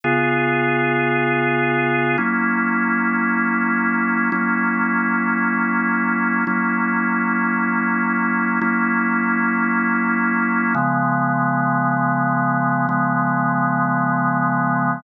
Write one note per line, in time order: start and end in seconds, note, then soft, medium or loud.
0.04 2.17 C#3 medium
0.04 2.17 B3 medium
0.04 2.17 F4 medium
0.04 2.17 G#4 medium
2.18 4.30 F#3 medium
2.18 4.30 A#3 medium
2.18 4.30 C#4 medium
2.18 4.30 E4 medium
4.32 6.45 F#3 medium
4.32 6.45 A#3 medium
4.32 6.45 C#4 medium
4.32 6.45 E4 medium
6.47 8.60 F#3 medium
6.47 8.60 A#3 medium
6.47 8.60 C#4 medium
6.47 8.60 E4 medium
8.62 10.74 F#3 medium
8.62 10.74 A#3 medium
8.62 10.74 C#4 medium
8.62 10.74 E4 medium
10.75 12.87 C#3 medium
10.75 12.87 F3 medium
10.75 12.87 G#3 medium
10.75 12.87 B3 medium
12.89 15.01 C#3 medium
12.89 15.01 F3 medium
12.89 15.01 G#3 loud
12.89 15.01 B3 medium